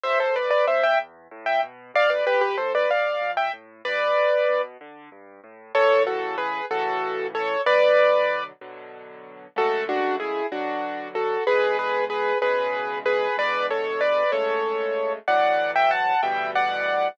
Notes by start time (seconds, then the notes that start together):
0.03 E2 C5 E5
0.20 A4 C5
0.35 A2 B4 D5
0.51 B4 D5
0.67 B2 C5 E5
0.83 E5 G5
0.99 E2
1.31 A2
1.46 E5 G5
1.63 B2
1.94 D2 D5 F5
2.10 B4 D5
2.26 F2 G4 B4
2.41 G4 B4
2.57 A2 A4 C5
2.75 B4 D5
2.90 D2 D5 F5
3.21 F2
3.37 E5 G5
3.53 A2
3.85 G2 B4 D5
4.17 A2
4.49 B2
4.81 D3
5.12 G2
5.44 A2
5.75 A2 C#3 E3 A4 C#5
6.07 F#4 A4
6.38 G#4 B4
6.71 A2 C#3 E3 F#4 A4
7.35 A4 C#5
7.66 B2 D3 F#3 B4 D5
8.61 B2 D3 F#3
9.56 F#2 C#3 G#3 A3 F#4 A4
9.89 D4 F#4
10.20 E4 G#4
10.52 B2 D3 F#3 D4 F#4
11.15 F#4 A4
11.47 E2 B2 D3 G#3 G#4 B4
11.79 G#4 B4
12.10 G#4 B4
12.42 E2 B2 C#3 G#3 G#4 B4
13.06 G#4 B4
13.37 E2 B2 D3 G#3 B4 D5
13.71 A4 C#5
14.01 B4 D5
14.32 F#2 C#3 G#3 A3 A4 C#5
15.28 D2 A2 E3 F#3 D5 F#5
15.76 E5 G5
15.91 F#5 A5
16.23 D2 B2 E3 G3 E5 G5
16.55 D5 F#5